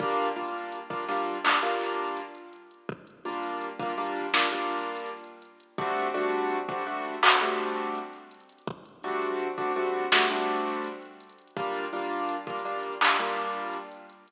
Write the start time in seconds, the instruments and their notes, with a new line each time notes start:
0.00 acoustic grand piano G3 A#3 D4 F4, kick, closed hi-hat
0.18 closed hi-hat
0.36 acoustic grand piano G3 A#3 D4 F4, closed hi-hat
0.54 closed hi-hat
0.72 closed hi-hat
0.90 acoustic grand piano G3 A#3 D4 F4, kick, closed hi-hat
1.08 acoustic grand piano G3 A#3 D4 F4, snare, closed hi-hat
1.17 closed hi-hat
1.27 closed hi-hat
1.36 closed hi-hat
1.44 acoustic grand piano G3 A#3 D4 F4, clap
1.63 acoustic grand piano G3 A#3 D4 F4, closed hi-hat
1.81 snare, closed hi-hat
1.99 closed hi-hat
2.17 closed hi-hat
2.35 closed hi-hat
2.53 closed hi-hat
2.71 closed hi-hat
2.89 kick, closed hi-hat
3.07 closed hi-hat
3.25 acoustic grand piano G3 A#3 D4 F4, closed hi-hat
3.34 closed hi-hat
3.43 closed hi-hat
3.52 closed hi-hat
3.61 closed hi-hat
3.80 acoustic grand piano G3 A#3 D4 F4, kick, closed hi-hat
3.98 acoustic grand piano G3 A#3 D4 F4, closed hi-hat
4.07 closed hi-hat
4.16 closed hi-hat
4.25 closed hi-hat
4.34 acoustic grand piano G3 A#3 D4 F4, snare
4.52 acoustic grand piano G3 A#3 D4 F4, closed hi-hat
4.70 closed hi-hat
4.79 closed hi-hat
4.88 closed hi-hat
4.97 closed hi-hat
5.06 closed hi-hat
5.24 closed hi-hat
5.42 closed hi-hat
5.60 closed hi-hat
5.78 acoustic grand piano G3 A3 C4 D4 F#4, kick, closed hi-hat
5.96 closed hi-hat
6.14 acoustic grand piano G3 A3 C4 D4 F#4, closed hi-hat
6.33 closed hi-hat
6.51 closed hi-hat
6.69 acoustic grand piano G3 A3 C4 D4 F#4, kick, closed hi-hat
6.87 acoustic grand piano G3 A3 C4 D4 F#4, closed hi-hat
7.05 closed hi-hat
7.23 acoustic grand piano G3 A3 C4 D4 F#4, clap
7.41 acoustic grand piano G3 A3 C4 D4 F#4, closed hi-hat
7.59 closed hi-hat
7.77 closed hi-hat
7.95 closed hi-hat
8.13 closed hi-hat
8.31 closed hi-hat
8.40 closed hi-hat
8.49 closed hi-hat
8.58 closed hi-hat
8.67 kick, closed hi-hat
8.86 closed hi-hat
9.04 acoustic grand piano G3 A3 C4 D4 F#4, closed hi-hat
9.22 closed hi-hat
9.40 closed hi-hat
9.58 acoustic grand piano G3 A3 C4 D4 F#4, kick, closed hi-hat
9.76 acoustic grand piano G3 A3 C4 D4 F#4, closed hi-hat
9.94 closed hi-hat
10.12 acoustic grand piano G3 A3 C4 D4 F#4, snare
10.30 acoustic grand piano G3 A3 C4 D4 F#4, closed hi-hat
10.48 closed hi-hat
10.57 closed hi-hat
10.66 closed hi-hat
10.75 closed hi-hat
10.84 closed hi-hat
11.02 closed hi-hat
11.20 closed hi-hat
11.30 closed hi-hat
11.39 closed hi-hat
11.48 closed hi-hat
11.57 acoustic grand piano G3 A#3 D4 F4, kick, closed hi-hat
11.75 closed hi-hat
11.93 acoustic grand piano G3 A#3 D4 F4, closed hi-hat
12.11 closed hi-hat
12.29 closed hi-hat
12.47 acoustic grand piano G3 A#3 D4 F4, kick, closed hi-hat
12.65 acoustic grand piano G3 A#3 D4 F4, closed hi-hat
12.83 closed hi-hat
13.01 acoustic grand piano G3 A#3 D4 F4, clap
13.19 acoustic grand piano G3 A#3 D4 F4, closed hi-hat
13.37 closed hi-hat
13.55 closed hi-hat
13.73 closed hi-hat
13.92 closed hi-hat
14.10 closed hi-hat
14.28 closed hi-hat